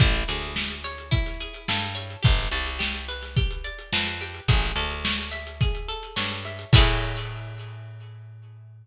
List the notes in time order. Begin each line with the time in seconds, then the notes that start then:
0.00 A1 E4, kick, closed hi-hat
0.14 snare, closed hi-hat
0.28 D2 G#4, snare, closed hi-hat
0.42 snare, closed hi-hat
0.56 A4, snare
0.70 closed hi-hat
0.84 C#5, closed hi-hat
0.98 closed hi-hat
1.11 E4, kick, closed hi-hat
1.26 snare, closed hi-hat
1.40 G#4, closed hi-hat
1.54 closed hi-hat
1.68 G2 A4, snare
1.82 closed hi-hat
1.95 C#5, closed hi-hat
2.10 closed hi-hat
2.23 G1 G4, kick, closed hi-hat
2.38 snare, closed hi-hat
2.52 C2 D5, closed hi-hat
2.66 closed hi-hat
2.79 G4, snare
2.94 closed hi-hat
3.08 B4, closed hi-hat
3.23 snare, closed hi-hat
3.36 G4, kick, closed hi-hat
3.51 closed hi-hat
3.64 D5, closed hi-hat
3.79 closed hi-hat
3.93 F2 B4, snare
4.07 closed hi-hat
4.21 G4, closed hi-hat
4.34 closed hi-hat
4.48 A1 G#4, kick, closed hi-hat
4.63 snare, closed hi-hat
4.76 D2 A4, closed hi-hat
4.91 closed hi-hat
5.05 C#5, snare
5.19 closed hi-hat
5.31 E5, snare, closed hi-hat
5.47 closed hi-hat
5.61 G#4, kick, closed hi-hat
5.75 closed hi-hat
5.88 A4, closed hi-hat
6.03 closed hi-hat
6.16 G2 C#5, snare
6.31 snare, closed hi-hat
6.45 E5, snare, closed hi-hat
6.59 closed hi-hat
6.73 A2 E4 G#4 A4 C#5, kick, crash